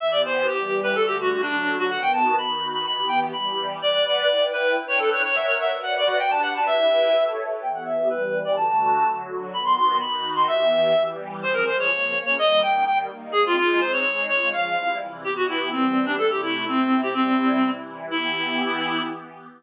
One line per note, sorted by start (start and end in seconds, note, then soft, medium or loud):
0.00 0.47 E3 medium
0.00 0.48 B3 medium
0.00 0.47 G4 medium
0.00 0.11 E5 medium
0.11 0.22 D5 medium
0.25 0.46 C5 medium
0.47 0.95 E3 medium
0.47 0.95 G3 medium
0.47 0.80 G4 medium
0.47 0.95 G4 medium
0.83 0.95 B4 medium
0.95 1.42 D3 medium
0.95 1.43 A3 medium
0.95 1.42 F#4 medium
0.95 1.06 A4 loud
1.07 1.18 G4 medium
1.20 1.41 F#4 medium
1.42 1.90 D3 medium
1.42 1.90 F#3 medium
1.42 1.75 D4 medium
1.42 1.89 F#4 medium
1.79 1.90 F#4 loud
1.89 2.36 D#3 medium
1.89 2.36 B3 medium
1.89 2.36 F#4 medium
1.89 2.01 F#5 loud
2.02 2.12 G5 medium
2.13 2.35 A5 medium
2.38 2.86 D#3 medium
2.38 2.86 D#4 medium
2.38 2.86 F#4 medium
2.38 2.67 B5 medium
2.73 2.85 B5 medium
2.85 3.33 E3 medium
2.85 3.33 B3 medium
2.85 3.33 G4 medium
2.85 3.07 B5 loud
3.08 3.19 G5 medium
3.33 3.80 E3 medium
3.33 3.80 G3 medium
3.33 3.80 G4 medium
3.33 3.66 B5 medium
3.81 4.28 B4 medium
3.81 4.28 D5 medium
3.81 4.04 D5 loud
3.81 4.28 F#5 medium
4.05 4.46 D5 medium
4.28 4.76 E4 medium
4.28 4.75 B4 medium
4.28 4.75 G5 medium
4.53 4.75 B4 medium
4.76 5.23 D4 medium
4.76 5.23 B4 medium
4.76 5.23 G5 medium
4.88 4.99 C#5 medium
4.99 5.10 A4 medium
5.12 5.22 C#5 medium
5.24 5.71 A#4 medium
5.24 5.71 C#5 medium
5.24 5.36 C#5 medium
5.24 5.71 E5 medium
5.24 5.71 F#5 medium
5.35 5.46 E5 medium
5.47 5.57 C#5 medium
5.61 5.72 E5 medium
5.72 6.19 F#4 medium
5.72 6.19 B4 medium
5.72 6.19 D5 medium
5.83 5.95 F#5 loud
5.97 6.08 D5 medium
6.07 6.18 F#5 medium
6.19 6.67 D4 medium
6.19 6.67 G4 medium
6.19 6.67 B4 medium
6.19 6.30 G5 medium
6.31 6.41 A5 loud
6.43 6.54 F#5 medium
6.56 6.67 A5 medium
6.67 7.15 E4 medium
6.67 7.15 G4 medium
6.67 7.15 B4 medium
6.67 7.24 E5 loud
7.15 7.62 A4 medium
7.15 7.62 C#5 medium
7.15 7.62 E5 medium
7.62 8.09 E3 medium
7.62 8.09 B3 medium
7.62 8.09 G4 medium
7.62 7.72 G5 medium
7.74 7.84 F#5 medium
7.85 8.08 E5 medium
8.09 8.57 E3 medium
8.09 8.57 G3 medium
8.09 8.57 G4 medium
8.09 8.39 B4 medium
8.45 8.56 D5 medium
8.56 9.04 D3 medium
8.56 9.04 A3 medium
8.56 9.04 F#4 medium
8.56 9.11 A5 medium
9.06 9.53 D3 medium
9.06 9.53 F#3 medium
9.06 9.52 F#4 medium
9.53 10.00 D#3 medium
9.53 10.00 B3 medium
9.53 10.00 F#4 medium
9.53 9.63 B5 medium
9.65 9.75 C6 medium
9.76 9.96 C6 loud
10.00 10.47 D#3 medium
10.00 10.47 D#4 medium
10.00 10.47 F#4 medium
10.00 10.30 B5 medium
10.36 10.47 C6 medium
10.48 10.95 E3 medium
10.48 10.95 B3 medium
10.48 10.95 G4 medium
10.48 11.03 E5 medium
10.96 11.44 E3 medium
10.96 11.44 G3 medium
10.96 11.44 G4 medium
11.43 11.66 F3 medium
11.43 11.67 C4 medium
11.43 11.66 G#4 medium
11.43 11.54 C5 loud
11.53 11.64 A#4 loud
11.66 11.90 F3 medium
11.66 11.90 G#3 medium
11.66 11.90 G#4 medium
11.66 11.76 C5 loud
11.79 12.19 C#5 medium
11.91 12.13 C#3 medium
11.91 12.14 F3 medium
11.91 12.13 A#3 medium
12.13 12.37 C#3 medium
12.13 12.37 A#3 medium
12.13 12.37 C#4 medium
12.26 12.35 C#5 loud
12.37 12.61 D#3 medium
12.37 12.61 G3 medium
12.37 12.61 A#3 medium
12.37 12.61 D#5 loud
12.61 12.85 D#3 medium
12.61 12.85 A#3 medium
12.61 12.85 D#4 medium
12.61 12.84 G5 medium
12.87 13.08 D#3 medium
12.87 13.10 G3 medium
12.87 13.08 A#3 medium
12.87 12.98 G5 loud
13.09 13.32 D#3 medium
13.09 13.32 A#3 medium
13.09 13.32 D#4 medium
13.32 13.56 G#3 medium
13.32 13.56 C4 medium
13.32 13.56 D#4 medium
13.32 13.43 G#4 loud
13.46 13.56 F4 loud
13.57 13.80 G#3 medium
13.57 13.80 D#4 medium
13.57 13.80 F4 loud
13.57 13.81 G#4 medium
13.80 14.04 G#3 medium
13.80 14.04 C4 medium
13.80 14.04 D#4 medium
13.80 13.92 C5 medium
13.93 14.26 C#5 medium
14.05 14.28 G#3 medium
14.05 14.28 D#4 medium
14.05 14.28 G#4 medium
14.28 14.52 C#3 medium
14.28 14.52 G#3 medium
14.28 14.52 F4 medium
14.28 14.49 C#5 loud
14.53 14.76 C#3 medium
14.53 14.76 F3 medium
14.53 14.76 F4 medium
14.53 14.97 F5 medium
14.76 15.00 C3 medium
14.76 15.00 G3 medium
14.76 15.00 E4 medium
15.00 15.24 C3 medium
15.00 15.23 E3 medium
15.00 15.24 E4 medium
15.23 15.70 E3 medium
15.23 15.70 B3 medium
15.23 15.70 G4 medium
15.23 15.34 G4 medium
15.36 15.46 F#4 medium
15.48 15.69 E4 medium
15.72 16.19 E3 medium
15.72 16.19 G3 medium
15.72 16.05 C4 medium
15.72 16.19 G4 medium
16.06 16.15 D4 medium
16.18 16.66 C3 medium
16.18 16.66 A3 medium
16.18 16.66 E4 medium
16.18 16.30 A4 loud
16.30 16.42 G4 medium
16.43 16.64 E4 medium
16.67 17.13 C3 medium
16.67 17.15 C4 medium
16.67 17.01 C4 medium
16.67 17.13 E4 medium
17.03 17.14 G4 medium
17.14 17.61 C3 medium
17.14 17.61 G3 medium
17.14 17.70 C4 medium
17.14 17.61 E4 medium
17.62 18.09 C3 medium
17.62 18.09 E3 medium
17.62 18.09 E4 medium
18.09 19.00 E3 medium
18.09 19.00 B3 medium
18.09 19.01 E4 loud
18.09 19.00 G4 medium